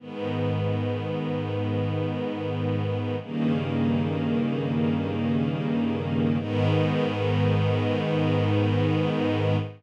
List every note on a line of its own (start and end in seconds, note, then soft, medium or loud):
0.00 3.16 G#2 medium
0.00 3.16 D#3 medium
0.00 3.16 B3 medium
3.21 6.38 G2 medium
3.21 6.38 C#3 medium
3.21 6.38 D#3 medium
3.21 6.38 A#3 medium
6.39 9.56 G#2 loud
6.39 9.56 D#3 loud
6.39 9.56 B3 loud